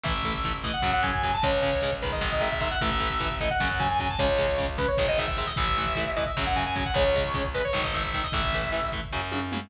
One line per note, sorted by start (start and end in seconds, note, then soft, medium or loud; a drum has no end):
0.04 0.71 A1 medium
0.04 0.13 E3 medium
0.04 0.13 A3 medium
0.04 0.54 E5 medium
0.04 kick loud
0.04 closed hi-hat loud
0.15 kick medium
0.23 0.33 E3 medium
0.23 0.33 A3 medium
0.23 kick medium
0.23 closed hi-hat medium
0.34 kick medium
0.44 0.53 E3 medium
0.44 0.53 A3 medium
0.44 kick medium
0.44 closed hi-hat loud
0.55 kick medium
0.62 0.72 E3 medium
0.62 0.72 A3 medium
0.62 0.73 D#5 medium
0.62 kick medium
0.62 closed hi-hat medium
0.73 0.91 F#5 medium
0.73 kick medium
0.82 1.37 F#2 medium
0.82 0.91 C#3 medium
0.82 0.91 F#3 medium
0.82 kick medium
0.82 snare loud
0.93 1.03 F#5 medium
0.93 kick medium
1.03 1.11 C#3 medium
1.03 1.11 F#3 medium
1.03 1.12 G#5 medium
1.03 kick medium
1.03 closed hi-hat medium
1.13 1.22 G#5 medium
1.13 kick medium
1.23 1.31 C#3 medium
1.23 1.31 F#3 medium
1.23 1.33 G#5 medium
1.23 kick medium
1.23 open hi-hat medium
1.34 1.43 A5 medium
1.34 kick medium
1.43 2.11 C#2 medium
1.43 1.51 C#3 medium
1.43 1.51 G#3 medium
1.43 1.93 C#5 medium
1.43 kick loud
1.43 closed hi-hat loud
1.52 kick medium
1.62 1.71 C#3 medium
1.62 1.71 G#3 medium
1.62 kick medium
1.62 closed hi-hat medium
1.73 kick medium
1.82 1.90 C#3 medium
1.82 1.90 G#3 medium
1.82 kick medium
1.82 closed hi-hat loud
1.92 kick medium
2.02 2.30 D#3 medium
2.02 2.30 G#3 medium
2.02 2.11 B4 medium
2.02 kick medium
2.02 closed hi-hat medium
2.12 2.28 D#5 medium
2.12 kick medium
2.21 2.76 G#1 loud
2.21 kick medium
2.21 snare loud
2.32 2.41 D#5 medium
2.32 kick medium
2.40 2.49 D#3 medium
2.40 2.49 G#3 medium
2.40 2.51 E5 medium
2.40 kick medium
2.40 closed hi-hat medium
2.51 2.61 E5 medium
2.51 kick medium
2.61 2.69 D#3 medium
2.61 2.69 G#3 medium
2.61 2.71 E5 medium
2.61 kick medium
2.61 closed hi-hat medium
2.71 2.80 F#5 medium
2.71 kick medium
2.81 3.49 A1 loud
2.81 2.90 E3 medium
2.81 2.90 A3 medium
2.81 3.35 E5 medium
2.81 kick loud
2.81 closed hi-hat loud
2.91 kick medium
3.00 3.08 E3 medium
3.00 3.08 A3 medium
3.00 kick medium
3.00 closed hi-hat medium
3.10 kick medium
3.20 3.28 E3 medium
3.20 3.28 A3 medium
3.20 kick loud
3.20 closed hi-hat loud
3.31 kick medium
3.39 3.49 E3 medium
3.39 3.49 A3 medium
3.39 3.50 D#5 medium
3.39 kick medium
3.39 closed hi-hat medium
3.50 3.67 F#5 medium
3.50 kick medium
3.60 4.15 F#2 loud
3.60 3.68 C#3 medium
3.60 3.68 F#3 medium
3.60 kick medium
3.60 snare loud
3.70 3.79 F#5 medium
3.70 kick medium
3.78 3.87 C#3 medium
3.78 3.87 F#3 medium
3.78 3.89 G#5 medium
3.78 kick medium
3.78 closed hi-hat medium
3.89 3.99 G#5 medium
3.89 kick medium
3.98 4.08 C#3 medium
3.98 4.08 F#3 medium
3.98 4.10 G#5 medium
3.98 kick medium
3.98 closed hi-hat medium
4.09 4.19 A5 medium
4.09 kick medium
4.19 4.87 C#2 medium
4.19 4.27 C#3 medium
4.19 4.27 G#3 medium
4.19 4.67 C#5 medium
4.19 kick loud
4.19 closed hi-hat loud
4.28 kick medium
4.38 4.46 C#3 medium
4.38 4.46 G#3 medium
4.38 kick medium
4.38 closed hi-hat medium
4.48 kick medium
4.58 4.66 C#3 medium
4.58 4.66 G#3 medium
4.58 kick medium
4.58 closed hi-hat loud
4.68 kick medium
4.78 4.86 C#3 medium
4.78 4.86 G#3 medium
4.78 4.87 B4 medium
4.78 kick loud
4.78 closed hi-hat medium
4.88 5.07 C#5 medium
4.88 kick medium
4.97 5.53 G#1 loud
4.97 5.06 D#3 medium
4.97 5.06 G#3 medium
4.97 kick loud
4.97 snare loud
5.08 5.18 D#5 medium
5.08 kick medium
5.18 5.26 D#3 medium
5.18 5.26 G#3 medium
5.18 5.27 E5 medium
5.18 kick medium
5.18 closed hi-hat medium
5.28 5.37 E5 medium
5.28 kick medium
5.37 5.46 D#3 medium
5.37 5.46 G#3 medium
5.37 5.47 E5 medium
5.37 kick medium
5.37 open hi-hat medium
5.47 5.56 D#5 medium
5.47 kick medium
5.56 6.25 A1 loud
5.56 5.65 E3 medium
5.56 5.65 A3 medium
5.56 6.11 E5 medium
5.56 kick loud
5.56 closed hi-hat loud
5.68 kick medium
5.77 5.85 E3 medium
5.77 5.85 A3 medium
5.77 kick medium
5.77 closed hi-hat medium
5.86 kick medium
5.95 6.05 E3 medium
5.95 6.05 A3 medium
5.95 kick medium
5.95 closed hi-hat loud
6.06 kick medium
6.16 6.25 E3 medium
6.16 6.25 A3 medium
6.16 6.25 D#5 medium
6.16 kick medium
6.16 closed hi-hat medium
6.26 6.43 E5 medium
6.26 kick medium
6.37 6.91 F#2 loud
6.37 6.45 C#3 medium
6.37 6.45 F#3 medium
6.37 kick medium
6.37 snare loud
6.47 6.56 F#5 medium
6.47 kick medium
6.54 6.64 C#3 medium
6.54 6.64 F#3 medium
6.54 6.65 G#5 medium
6.54 kick medium
6.54 closed hi-hat medium
6.65 6.75 G#5 medium
6.65 kick medium
6.76 6.84 C#3 medium
6.76 6.84 F#3 medium
6.76 6.85 G#5 medium
6.76 kick medium
6.76 closed hi-hat medium
6.86 6.95 F#5 medium
6.86 kick medium
6.94 7.61 C#2 medium
6.94 7.03 C#3 medium
6.94 7.03 G#3 medium
6.94 7.45 C#5 medium
6.94 kick loud
6.94 closed hi-hat loud
7.05 kick medium
7.15 7.23 C#3 medium
7.15 7.23 G#3 medium
7.15 kick medium
7.15 closed hi-hat medium
7.25 kick medium
7.34 7.43 C#3 medium
7.34 7.43 G#3 medium
7.34 kick loud
7.34 closed hi-hat loud
7.45 kick medium
7.54 7.62 C#3 medium
7.54 7.62 G#3 medium
7.54 7.64 B4 medium
7.54 kick medium
7.54 closed hi-hat medium
7.64 7.81 C#5 medium
7.64 kick medium
7.73 8.28 G#1 loud
7.73 7.82 D#3 medium
7.73 7.82 G#3 medium
7.73 kick medium
7.73 snare loud
7.83 7.93 D#5 medium
7.83 kick medium
7.94 8.02 D#3 medium
7.94 8.02 G#3 medium
7.94 8.03 E5 medium
7.94 kick medium
7.94 closed hi-hat medium
8.03 8.13 E5 medium
8.03 kick medium
8.13 8.22 D#3 medium
8.13 8.22 G#3 medium
8.13 8.23 E5 medium
8.13 kick medium
8.13 closed hi-hat medium
8.24 8.33 D#5 medium
8.24 kick medium
8.32 9.00 A1 medium
8.32 8.41 E3 medium
8.32 8.41 A3 medium
8.32 8.89 E5 medium
8.32 kick loud
8.32 closed hi-hat loud
8.44 kick loud
8.53 8.62 E3 medium
8.53 8.62 A3 medium
8.53 kick medium
8.53 closed hi-hat medium
8.63 kick medium
8.72 8.80 E3 medium
8.72 8.80 A3 medium
8.72 closed hi-hat loud
8.82 kick medium
8.92 9.01 E3 medium
8.92 9.01 A3 medium
8.92 kick medium
8.92 closed hi-hat medium
9.04 kick medium
9.12 9.67 F#2 loud
9.12 9.21 C#3 medium
9.12 9.21 F#3 medium
9.12 kick medium
9.12 snare medium
9.32 9.40 C#3 medium
9.32 9.40 F#3 medium
9.32 high tom medium
9.52 9.60 C#3 medium
9.52 9.60 F#3 medium
9.52 mid tom loud